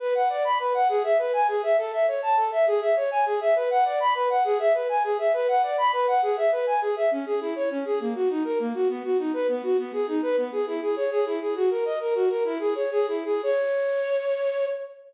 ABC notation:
X:1
M:6/8
L:1/8
Q:3/8=135
K:Bdor
V:1 name="Flute"
B f d b B f | G e B g G e | A e c a A e | G e c g G e |
B f d b B f | G e B g G e | B f d b B f | G e B g G e |
[K:C#dor] C G E c C G | A, F D A A, F | B, F D B B, F | B, G D B B, G |
E G c G E G | F A d A F A | "^rit." E G c G E G | c6 |]